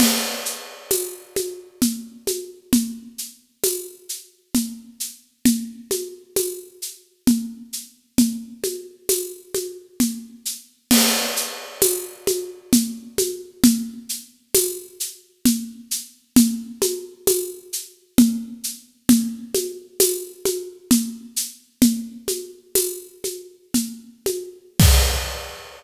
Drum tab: CC |x-----|------|------|------|
TB |--x---|--x---|--x---|--x---|
SH |xxxxxx|xxxxxx|xxxxxx|xxxxxx|
CG |O-ooOo|O-o-O-|Ooo-O-|OoooO-|
BD |------|------|------|------|

CC |x-----|------|------|------|
TB |--x---|--x---|--x---|--x---|
SH |xxxxxx|xxxxxx|xxxxxx|xxxxxx|
CG |O-ooOo|O-o-O-|Ooo-O-|OoooO-|
BD |------|------|------|------|

CC |------|x-----|
TB |--x---|------|
SH |xxxxxx|------|
CG |OoooOo|------|
BD |------|o-----|